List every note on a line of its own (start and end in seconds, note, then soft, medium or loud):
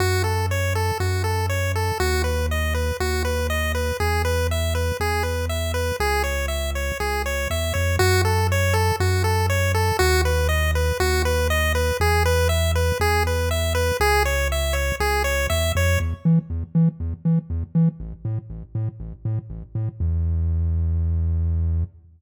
0.00 0.92 F#2 medium
0.00 0.23 F#4 loud
0.24 0.46 A4 medium
0.51 0.74 C#5 medium
0.75 0.98 A4 medium
1.00 1.92 F#2 medium
1.00 1.23 F#4 medium
1.24 1.46 A4 medium
1.49 1.72 C#5 medium
1.76 1.98 A4 medium
2.00 2.92 D#2 medium
2.00 2.22 F#4 loud
2.24 2.46 B4 medium
2.51 2.74 D#5 medium
2.74 2.97 B4 medium
3.00 3.92 D#2 medium
3.00 3.23 F#4 medium
3.25 3.47 B4 medium
3.50 3.72 D#5 medium
3.75 3.97 B4 medium
4.00 4.92 E2 medium
4.00 4.22 G#4 medium
4.25 4.47 B4 medium
4.51 4.74 E5 medium
4.75 4.97 B4 medium
5.00 5.92 E2 medium
5.00 5.23 G#4 medium
5.23 5.46 B4 medium
5.49 5.72 E5 medium
5.74 5.96 B4 medium
6.00 6.92 C#2 medium
6.00 6.23 G#4 loud
6.24 6.46 C#5 medium
6.48 6.71 E5 medium
6.75 6.98 C#5 medium
7.00 7.47 C#2 medium
7.00 7.22 G#4 medium
7.26 7.48 C#5 medium
7.50 7.73 E2 medium
7.50 7.73 E5 medium
7.74 7.98 F2 medium
7.74 7.96 C#5 medium
7.99 8.92 F#2 loud
7.99 8.22 F#4 loud
8.25 8.47 A4 medium
8.52 8.74 C#5 medium
8.74 8.96 A4 medium
9.00 9.92 F#2 medium
9.00 9.23 F#4 medium
9.24 9.46 A4 medium
9.50 9.72 C#5 medium
9.74 9.97 A4 medium
9.99 10.92 D#2 loud
9.99 10.21 F#4 loud
10.25 10.48 B4 medium
10.49 10.71 D#5 medium
10.75 10.98 B4 medium
11.00 11.92 D#2 medium
11.00 11.22 F#4 loud
11.25 11.48 B4 medium
11.50 11.73 D#5 loud
11.75 11.97 B4 medium
12.00 12.92 E2 loud
12.00 12.23 G#4 loud
12.26 12.48 B4 loud
12.49 12.72 E5 medium
12.75 12.98 B4 medium
13.00 13.92 E2 medium
13.00 13.23 G#4 loud
13.27 13.49 B4 medium
13.51 13.73 E5 medium
13.75 13.97 B4 medium
14.00 14.92 C#2 loud
14.00 14.23 G#4 loud
14.25 14.48 C#5 medium
14.52 14.74 E5 medium
14.73 14.96 C#5 medium
15.00 15.47 C#2 medium
15.00 15.23 G#4 loud
15.24 15.47 C#5 medium
15.50 15.72 E2 medium
15.50 15.72 E5 loud
15.75 15.98 F2 loud
15.75 15.99 C#5 medium
16.00 16.14 E2 medium
16.25 16.39 E3 medium
16.50 16.64 E2 medium
16.75 16.89 E3 medium
17.00 17.14 E2 medium
17.25 17.39 E3 medium
17.50 17.64 E2 medium
17.75 17.89 E3 medium
18.00 18.14 A1 medium
18.25 18.39 A2 medium
18.50 18.64 A1 medium
18.75 18.89 A2 medium
19.00 19.14 A1 medium
19.25 19.39 A2 medium
19.50 19.64 A1 medium
19.75 19.89 A2 medium
20.00 21.84 E2 loud